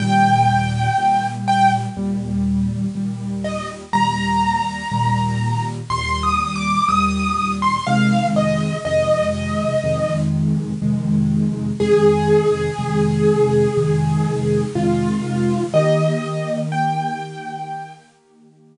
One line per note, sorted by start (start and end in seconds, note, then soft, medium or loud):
0.00 0.89 D#2 medium
0.00 0.89 A#2 medium
0.00 0.89 G3 medium
0.00 1.26 G5 loud
0.98 1.86 D#2 medium
0.98 1.86 A#2 medium
0.98 1.86 G3 medium
1.48 1.71 G5 loud
1.97 2.85 D#2 medium
1.97 2.85 A#2 medium
1.97 2.85 G3 medium
2.95 3.84 D#2 medium
2.95 3.84 A#2 medium
2.95 3.84 G3 medium
3.44 3.68 D#5 medium
3.93 4.82 D#2 medium
3.93 4.82 A#2 medium
3.93 4.82 G3 medium
3.93 5.64 A#5 loud
4.91 5.80 D#2 medium
4.91 5.80 A#2 medium
4.91 5.80 G3 medium
5.90 6.78 D#2 medium
5.90 6.78 A#2 medium
5.90 6.78 G3 medium
5.90 6.21 C6 loud
6.23 6.54 D#6 medium
6.56 6.87 D6 loud
6.89 7.77 D#2 medium
6.89 7.77 A#2 medium
6.89 7.77 G3 medium
6.89 7.53 D#6 loud
7.62 7.85 C6 loud
7.87 8.76 F2 medium
7.87 8.76 C3 medium
7.87 8.76 D#3 medium
7.87 8.76 G#3 medium
7.87 8.26 F5 loud
8.36 8.77 D#5 loud
8.85 9.74 F2 medium
8.85 9.74 C3 medium
8.85 9.74 D#3 medium
8.85 9.74 G#3 medium
8.85 10.17 D#5 loud
9.84 10.72 F2 medium
9.84 10.72 C3 medium
9.84 10.72 D#3 medium
9.84 10.72 G#3 medium
10.82 11.70 F2 medium
10.82 11.70 C3 medium
10.82 11.70 D#3 medium
10.82 11.70 G#3 medium
11.80 12.69 F2 medium
11.80 12.69 C3 medium
11.80 12.69 D#3 medium
11.80 12.69 G#3 medium
11.80 14.62 G#4 loud
12.78 13.67 F2 medium
12.78 13.67 C3 medium
12.78 13.67 D#3 medium
12.78 13.67 G#3 medium
13.77 14.65 F2 medium
13.77 14.65 C3 medium
13.77 14.65 D#3 medium
13.77 14.65 G#3 medium
14.75 15.64 F2 medium
14.75 15.64 C3 medium
14.75 15.64 D#3 medium
14.75 15.64 G#3 medium
14.75 15.62 F4 medium
15.74 18.77 D#3 medium
15.74 18.77 A#3 medium
15.74 18.77 G4 medium
15.74 16.58 D#5 loud
16.72 18.02 G5 loud